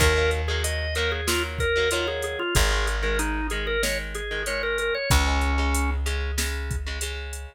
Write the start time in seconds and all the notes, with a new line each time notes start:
0.00 D#2 D#3 F#3 A#3 A#4, kick, closed hi-hat
0.16 D#3 F#3 A#3
0.31 closed hi-hat
0.48 D#3 F#3 A#3 G#4
0.64 D#5, closed hi-hat
0.95 D#3 F#3 A#3 A#4, closed hi-hat
1.12 G#4
1.27 D#3 F#3 A#3 F4, snare
1.59 A#4, kick, closed hi-hat
1.76 D#3 F#3 A#3
1.91 D#3 F#3 A#3 F4, closed hi-hat
2.08 G#4
2.22 G#4, closed hi-hat
2.39 F4
2.55 G#1 D#3 G#3 G#4, kick, closed hi-hat
2.71 D#3 G#3
2.87 closed hi-hat
3.02 D#3 G#3 A#4
3.19 D#4, closed hi-hat
3.50 D#3 G#3 G#4, closed hi-hat
3.67 A#4
3.83 D#3 G#3 C#5, snare
4.15 G#4, closed hi-hat
4.31 D#3 G#3
4.46 D#3 G#3 C#5, closed hi-hat
4.63 A#4
4.78 A#4, closed hi-hat
4.95 C#5
5.10 C#2 C#3 G#3 C#4, kick, closed hi-hat
5.27 C#3 G#3
5.41 closed hi-hat
5.58 C#3 G#3
5.74 closed hi-hat
6.06 C#3 G#3, closed hi-hat
6.38 C#3 G#3, snare
6.71 kick, closed hi-hat
6.87 C#3 G#3
7.01 C#3 G#3, closed hi-hat
7.33 closed hi-hat